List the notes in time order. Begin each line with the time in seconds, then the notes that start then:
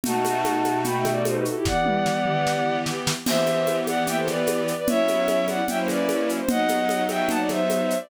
0.04 B2 A3 D#4 F#4 F#5 A5, low conga, shaker
0.25 high conga, shaker
0.45 high conga, shaker
0.64 high conga, shaker
0.84 G5 B5, low conga, shaker
0.99 E5 G5
1.05 snare, high conga, shaker
1.11 D5
1.25 A4 C5, high conga, shaker
1.35 G4 B4
1.45 F#4 A4, shaker
1.55 E4 G4
1.65 E3 B3 G4 D5 F#5, kick, snare
1.86 high tom
2.06 snare
2.26 mid tom
2.47 snare
2.86 snare
3.07 snare
3.26 E3 B3 G4 C5 E5, crash, low conga, shaker
3.46 high conga, shaker
3.67 high conga, shaker
3.87 D5 F#5, high conga, shaker
4.07 E5 G5, low conga, shaker
4.17 A4 C5
4.28 B4 D5, snare, high conga, shaker
4.47 high conga, shaker
4.68 shaker
4.78 B4 D5
4.87 F#3 B3 C#4 E4 C#5 E5, low conga, shaker
5.08 high conga, shaker
5.28 high conga, shaker
5.48 D5 F#5, high conga, shaker
5.67 F#3 A#3 C#4 E4 E5 G5, low conga, shaker
5.78 C5
5.88 B4 D5, snare, high conga, shaker
6.09 high conga, shaker
6.29 shaker
6.39 C5
6.49 F#3 B3 D#4 D#5 F#5, low conga, shaker
6.68 high conga, shaker
6.89 high conga, shaker
7.09 E5 G5, high conga, shaker
7.29 F#5 A5, low conga, shaker
7.39 D5
7.49 C5 E5, snare, high conga, shaker
7.70 high conga, shaker
7.90 shaker
8.00 D5